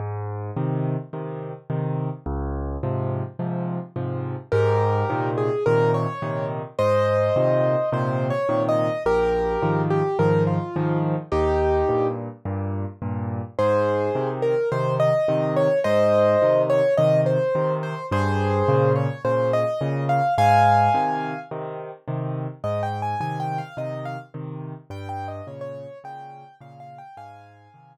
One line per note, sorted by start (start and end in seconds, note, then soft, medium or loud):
0.00 0.51 G#2 medium
0.56 0.96 C3 medium
0.56 0.96 D#3 medium
1.13 1.53 C3 medium
1.13 1.53 D#3 medium
1.70 2.09 C3 medium
1.70 2.09 D#3 medium
2.26 2.77 C#2 loud
2.83 3.23 G#2 medium
2.83 3.23 C3 medium
2.83 3.23 F3 medium
3.39 3.79 G#2 medium
3.39 3.79 C3 medium
3.39 3.79 F3 medium
3.96 4.35 G#2 medium
3.96 4.35 C3 medium
3.96 4.35 F3 medium
4.52 5.04 G#2 loud
4.52 5.29 G4 medium
4.52 5.29 A#4 medium
5.10 5.49 A#2 medium
5.10 5.49 C3 medium
5.10 5.49 D#3 medium
5.38 5.64 G#4 medium
5.66 6.06 A#2 medium
5.66 6.06 C3 medium
5.66 6.06 D#3 medium
5.66 5.92 A#4 medium
5.94 6.46 C#5 medium
6.22 6.62 A#2 medium
6.22 6.62 C3 medium
6.22 6.62 D#3 medium
6.79 7.30 G#2 medium
6.79 7.90 C5 medium
6.79 7.90 D#5 medium
7.36 7.76 A#2 medium
7.36 7.76 C3 medium
7.36 7.76 D#3 medium
7.92 8.32 A#2 medium
7.92 8.32 C3 medium
7.92 8.32 D#3 medium
7.92 8.27 C5 medium
8.30 8.62 C#5 medium
8.49 8.89 A#2 medium
8.49 8.89 C3 medium
8.49 8.89 D#3 medium
8.69 9.03 D#5 medium
9.06 9.57 A#1 medium
9.06 9.82 G4 medium
9.06 9.82 A#4 medium
9.62 10.02 G#2 medium
9.62 10.02 D#3 medium
9.62 10.02 F3 medium
9.90 10.17 G4 medium
10.19 10.58 G#2 medium
10.19 10.58 D#3 medium
10.19 10.58 F3 medium
10.19 10.43 A#4 medium
10.47 10.98 F4 medium
10.76 11.16 G#2 medium
10.76 11.16 D#3 medium
10.76 11.16 F3 medium
11.32 11.83 D#2 medium
11.32 12.07 D#4 medium
11.32 12.07 G4 medium
11.89 12.29 G2 medium
11.89 12.29 A#2 medium
12.45 12.85 G2 medium
12.45 12.85 A#2 medium
13.02 13.42 G2 medium
13.02 13.42 A#2 medium
13.59 14.10 G#2 medium
13.59 14.29 G#4 medium
13.59 14.29 C5 medium
14.15 14.55 C3 medium
14.15 14.55 D#3 medium
14.42 14.69 A#4 medium
14.72 15.11 C3 medium
14.72 15.11 D#3 medium
14.72 14.95 C5 medium
15.00 15.53 D#5 medium
15.28 15.68 C3 medium
15.28 15.68 D#3 medium
15.56 15.79 C#5 medium
15.84 16.36 G#2 medium
15.84 16.62 C5 medium
15.84 16.62 D#5 medium
16.42 16.81 C3 medium
16.42 16.81 D#3 medium
16.70 16.94 C#5 medium
16.97 17.38 C3 medium
16.97 17.38 D#3 medium
16.97 17.21 D#5 medium
17.26 17.74 C5 medium
17.55 17.95 C3 medium
17.55 17.95 D#3 medium
17.83 18.06 C5 medium
18.11 18.62 G2 medium
18.11 18.92 G#4 medium
18.11 18.92 C5 medium
18.68 19.08 A#2 medium
18.68 19.08 C#3 medium
18.96 19.22 C#5 medium
19.25 19.64 A#2 medium
19.25 19.64 C#3 medium
19.25 19.51 C5 medium
19.53 20.04 D#5 medium
19.81 20.21 A#2 medium
19.81 20.21 C#3 medium
20.09 20.34 F5 medium
20.38 20.89 G#2 medium
20.38 21.39 F5 medium
20.38 21.39 G#5 medium
20.94 21.34 C3 medium
20.94 21.34 D#3 medium
21.51 21.91 C3 medium
21.51 21.91 D#3 medium
22.08 22.47 C3 medium
22.08 22.47 D#3 medium
22.64 23.15 G#2 medium
22.64 22.82 D#5 medium
22.83 23.01 G5 medium
23.02 23.20 G#5 medium
23.20 23.60 C3 medium
23.20 23.60 D#3 medium
23.20 23.39 G#5 medium
23.40 23.58 G5 medium
23.58 23.76 F5 medium
23.77 24.17 C3 medium
23.77 24.17 D#3 medium
23.77 24.04 D#5 medium
24.05 24.19 F5 medium
24.34 24.74 C3 medium
24.34 24.74 D#3 medium
24.90 25.41 G2 loud
24.90 25.08 G5 medium
25.09 25.27 G5 medium
25.28 25.46 D#5 medium
25.47 25.87 A#2 medium
25.47 25.87 C#3 medium
25.47 25.61 C#5 medium
25.61 25.98 C#5 medium
26.04 26.43 A#2 medium
26.04 26.43 C#3 medium
26.04 26.55 G5 medium
26.60 27.00 A#2 medium
26.60 27.00 C#3 medium
26.60 26.79 F5 medium
26.80 26.98 F5 medium
26.98 27.16 G5 medium
27.17 27.68 G#2 medium
27.17 27.93 F5 medium
27.17 27.93 G#5 medium
27.74 27.97 C3 medium
27.74 27.97 D#3 medium